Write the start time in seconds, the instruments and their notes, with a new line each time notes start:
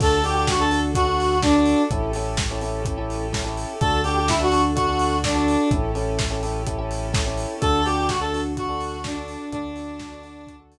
0.00 synth bass 1 D2, string ensemble 1 D4 F#4 A4, electric piano 1 D4 F#4 A4, lead 1 (square) A4, kick, crash
0.23 electric piano 1 D4 F#4 A4, lead 1 (square) G4, open hi-hat
0.34 lead 1 (square) G4
0.47 lead 1 (square) F#4, kick, snare
0.60 electric piano 1 D4 F#4 A4, lead 1 (square) A4
0.71 electric piano 1 D4 F#4 A4, open hi-hat
0.94 electric piano 1 D4 F#4 A4, lead 1 (square) F#4, kick, closed hi-hat
1.07 electric piano 1 D4 F#4 A4
1.20 open hi-hat
1.42 lead 1 (square) D4, electric piano 1 D4 F#4 A4, kick, snare
1.55 electric piano 1 D4 F#4 A4
1.66 open hi-hat
1.90 synth bass 1 A1, string ensemble 1 C#4 E4 G4 A4, electric piano 1 C#4 E4 G4 A4, kick, closed hi-hat
2.13 electric piano 1 C#4 E4 G4 A4, open hi-hat
2.37 kick, snare
2.51 electric piano 1 C#4 E4 G4 A4
2.61 electric piano 1 C#4 E4 G4 A4, open hi-hat
2.85 electric piano 1 C#4 E4 G4 A4, kick, closed hi-hat
2.98 electric piano 1 C#4 E4 G4 A4
3.10 open hi-hat
3.33 electric piano 1 C#4 E4 G4 A4, kick, snare
3.45 electric piano 1 C#4 E4 G4 A4
3.57 open hi-hat
3.80 synth bass 1 D2, string ensemble 1 D4 F#4 A4, electric piano 1 D4 F#4 A4, lead 1 (square) A4, kick, closed hi-hat
4.03 electric piano 1 D4 F#4 A4, lead 1 (square) G4, open hi-hat
4.16 lead 1 (square) G4
4.28 lead 1 (square) E4, kick, snare
4.40 electric piano 1 D4 F#4 A4, lead 1 (square) F#4
4.52 electric piano 1 D4 F#4 A4, open hi-hat
4.75 electric piano 1 D4 F#4 A4, lead 1 (square) F#4, kick, closed hi-hat
4.88 electric piano 1 D4 F#4 A4
4.99 open hi-hat
5.24 lead 1 (square) D4, electric piano 1 D4 F#4 A4, kick, snare
5.35 electric piano 1 D4 F#4 A4
5.48 open hi-hat
5.71 synth bass 1 A1, electric piano 1 C#4 E4 G4 A4, string ensemble 1 C#4 E4 G4 A4, kick, closed hi-hat
5.95 electric piano 1 C#4 E4 G4 A4, open hi-hat
6.19 kick, snare
6.31 electric piano 1 C#4 E4 G4 A4
6.43 electric piano 1 C#4 E4 G4 A4, open hi-hat
6.67 electric piano 1 C#4 E4 G4 A4, kick, closed hi-hat
6.78 electric piano 1 C#4 E4 G4 A4
6.91 open hi-hat
7.13 electric piano 1 C#4 E4 G4 A4, kick, snare
7.26 electric piano 1 C#4 E4 G4 A4
7.38 open hi-hat
7.61 synth bass 1 D2, electric piano 1 D4 F#4 A4, string ensemble 1 D4 F#4 A4, lead 1 (square) A4, kick, closed hi-hat
7.85 electric piano 1 D4 F#4 A4, lead 1 (square) G4, open hi-hat
7.96 lead 1 (square) G4
8.08 lead 1 (square) F#4, kick, snare
8.20 electric piano 1 D4 F#4 A4, lead 1 (square) A4
8.34 electric piano 1 D4 F#4 A4, open hi-hat
8.57 electric piano 1 D4 F#4 A4, lead 1 (square) F#4, kick, closed hi-hat
8.69 electric piano 1 D4 F#4 A4
8.81 open hi-hat
9.04 electric piano 1 D4 F#4 A4, lead 1 (square) D4, kick, snare
9.15 electric piano 1 D4 F#4 A4
9.28 open hi-hat
9.52 synth bass 1 D2, lead 1 (square) D4, string ensemble 1 D4 F#4 A4, electric piano 1 D4 F#4 A4, kick, closed hi-hat
9.76 electric piano 1 D4 F#4 A4, open hi-hat
9.99 kick, snare
10.12 electric piano 1 D4 F#4 A4
10.23 electric piano 1 D4 F#4 A4, open hi-hat
10.47 electric piano 1 D4 F#4 A4, kick, closed hi-hat
10.59 electric piano 1 D4 F#4 A4
10.72 open hi-hat